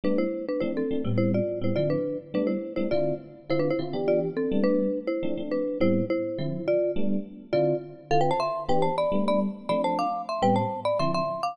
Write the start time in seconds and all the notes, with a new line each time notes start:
0.04 G3 A3 B3 D4 B4
0.18 E4 C5
0.48 D4 B4
0.60 F3 A3 C4 D4 E4 C5
0.77 C4 A4
0.91 F3 A3 C4 D4
1.05 A2 G3 B3 C4
1.18 E4 C5
1.34 F4 D5
1.61 A2 G3 B3 C4 E4 C5
1.76 D3 F3 C4 E4 F4 D5
1.90 D4 B4
2.34 G3 A3 B3 D4 B4
2.47 E4 C5
2.76 G3 A3 B3 D4 E4 C5
2.91 D3 C4 E4 F4 D5
3.50 D3 C4 E4 F4 C5
3.59 D4 B4
3.70 E4 C5
3.79 D3 C4 E4 F4
3.93 E3 B3 D4 G4
4.08 F4 D5
4.37 C4 A4
4.52 G3 A3 B3 D4
4.64 D4 B4
5.07 E4 C5
5.23 F3 A3 C4 D4
5.37 F3 A3 C4 D4
5.51 D4 B4
5.80 A2 G3 B3 C4 E4 C5
6.10 E4 C5
6.38 D3 F3 C4 E4
6.68 F4 D5
6.96 G3 A3 B3 D4
7.53 D3 C4 E4 F4 D5
8.11 D3 C4 E4 F4 A4 F5
8.21 B4 G5
8.31 C5 A5
8.40 E5 C6
8.69 E3 B3 D4 G4 B4 G5
8.82 C5 A5
8.98 D5 B5
9.12 G3 A3 B3 D4
9.28 D5 B5
9.69 F3 A3 C4 D4 D5 B5
9.84 C5 A5
9.99 F5 D6
10.29 E5 C6
10.42 A2 G3 B3 C4 B4 G5
10.56 C5 A5
10.85 D5 B5
10.99 D3 F3 C4 E4 E5 C6
11.14 E5 C6
11.43 F5 D6